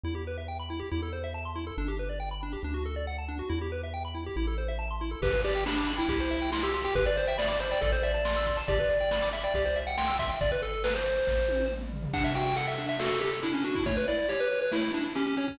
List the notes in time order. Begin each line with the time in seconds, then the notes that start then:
0.04 E2 E4
0.15 G4
0.27 B4
0.38 E5
0.48 G5
0.59 B5
0.70 E4
0.80 G4
0.91 E2 E4
1.03 A4
1.13 C5
1.24 E5
1.34 A5
1.45 C6
1.56 E4
1.67 A4
1.77 G1 D4
1.88 G4
1.99 B4
2.09 D5
2.20 G5
2.31 B5
2.43 D4
2.53 G4
2.63 D2 D4
2.74 F#4
2.86 A4
2.96 D5
3.07 F#5
3.18 A5
3.28 D4
3.39 F#4
3.49 E2 E4
3.61 G4
3.72 B4
3.83 E5
3.94 G5
4.05 B5
4.15 E4
4.26 G4
4.36 A1 E4
4.47 A4
4.58 C5
4.68 E5
4.79 A5
4.91 C6
5.01 E4
5.11 A4
5.22 G1 G4 B4, kick, crash
5.33 B4, kick, closed hi-hat
5.44 G4 D5, closed hi-hat
5.55 G5, closed hi-hat
5.66 D4 B5, snare
5.77 D6, closed hi-hat
5.87 B5, closed hi-hat
5.98 E4 G5, closed hi-hat
6.08 C2 G4, kick, closed hi-hat
6.20 C5, closed hi-hat
6.31 E5, closed hi-hat
6.41 G5, closed hi-hat
6.52 E4 C6, snare
6.63 G4 E6, closed hi-hat
6.74 G4 C6, closed hi-hat
6.84 G4 G5, open hi-hat
6.95 G1 G4 B4, kick, closed hi-hat
7.06 B4 D5, closed hi-hat
7.16 C5 D5, closed hi-hat
7.27 E5 G5, closed hi-hat
7.38 D5 B5, snare
7.48 D5 D6, closed hi-hat
7.60 C5 B5, closed hi-hat
7.71 D5 G5, closed hi-hat
7.81 A1 A4 D5, kick, closed hi-hat
7.92 C5, closed hi-hat
8.03 D5 E5, closed hi-hat
8.14 A5, closed hi-hat
8.25 C6, snare
8.36 E6, closed hi-hat
8.46 C6, kick, closed hi-hat
8.57 A5, closed hi-hat
8.68 G1 G4 D5, kick, closed hi-hat
8.79 B4, kick, closed hi-hat
8.89 D5, closed hi-hat
9.00 G5, closed hi-hat
9.11 B5, snare
9.22 D6, closed hi-hat
9.33 E5 B5, closed hi-hat
9.44 D5 G5, closed hi-hat
9.54 C2 G4, kick, closed hi-hat
9.65 C5, closed hi-hat
9.76 E5, closed hi-hat
9.87 F#5 G5, closed hi-hat
9.97 G5 C6, snare
10.08 E6, closed hi-hat
10.19 E5 C6, kick, closed hi-hat
10.30 G5, closed hi-hat
10.41 G1 D5, kick, closed hi-hat
10.52 B4, closed hi-hat
10.62 A4, closed hi-hat
10.73 closed hi-hat
10.84 B4, snare
10.95 C5, closed hi-hat
11.05 closed hi-hat
11.16 closed hi-hat
11.27 A1, kick, snare
11.48 high tom
11.59 high tom
11.70 mid tom
11.81 mid tom
11.92 floor tom
12.03 floor tom
12.13 D4 F#5, kick, crash
12.24 E5, closed hi-hat
12.35 F#4 G5, closed hi-hat
12.46 G5, closed hi-hat
12.56 A4 F#5, closed hi-hat
12.67 E5, closed hi-hat
12.78 D4, closed hi-hat
12.89 E5, closed hi-hat
12.99 F#4 A4, snare
13.11 closed hi-hat
13.21 G4 A4, closed hi-hat
13.32 closed hi-hat
13.43 D4 E4, closed hi-hat
13.54 C#4, closed hi-hat
13.64 D4 F#4, closed hi-hat
13.75 E4, kick, open hi-hat
13.86 A3 C#5, kick, closed hi-hat
13.97 B4, closed hi-hat
14.08 E4 D5, closed hi-hat
14.18 D5, closed hi-hat
14.29 G4 C#5, closed hi-hat
14.40 B4, closed hi-hat
14.51 C#5, closed hi-hat
14.61 B4, closed hi-hat
14.71 A3 E4, snare
14.83 closed hi-hat
14.94 D4 E4, closed hi-hat
15.05 closed hi-hat
15.15 C#4 G4, closed hi-hat
15.26 C#4, closed hi-hat
15.37 C#4 C#5, closed hi-hat
15.48 C#4, kick, closed hi-hat